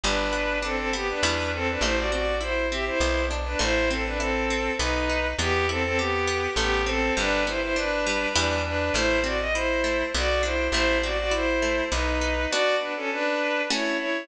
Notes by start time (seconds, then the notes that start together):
0.04 G1 G3 D4 B4
0.33 B3
0.62 C4 D4 A4
0.76 C4 A4
0.93 B3 G4
1.09 D4 B4
1.23 E2 G3 B3 E4
1.54 C4 A4
1.69 D4 B4
1.81 A1 A3 E4 C5
1.97 F#4 D5
2.11 C4 F#4 D5
2.40 E4 C5
2.71 C4 G4 E5
2.86 E4 C5
3.00 B1 B3
3.31 D4
3.45 D4 B4
3.59 A1 A3 E4 C5
3.90 C4 A4
4.05 D4 B4
4.18 C4 E4 A4
4.50 C4
4.78 B1 B3 D#4 B4
5.10 D#4
5.38 E2 B3 G4
5.69 C4 E4 A4
5.84 C4 A4
5.97 B3 G4
6.27 B3
6.56 A1 A3 B3 G4
6.87 C4 A4
7.17 G1 G3 D4 B4
7.46 B3 E4 C5
7.62 E4 C5
7.76 D4 B4
8.07 G3
8.34 E2 G3 B3 D4 E4 B4
8.64 D4 B4
8.94 A1 A3 E4 C5
9.24 C4 F#4 D5
9.40 D#5
9.54 E4 C5
9.84 A3
10.14 B1 B3 F#4 D5
10.43 D4 E4 C5
10.72 A1 A3 E4 C5
11.03 C4 F#4 D5
11.19 F#4 D5
11.31 E4 C5
11.62 A3
11.91 B1 B3 D#4 B4
12.21 D#4
12.50 B3 D4 F#4 D5
12.80 D4 B4
12.96 C#4 A4
13.12 D4 B4
13.70 A3 C#4 E4 F#4 C#5
13.98 E4 C#5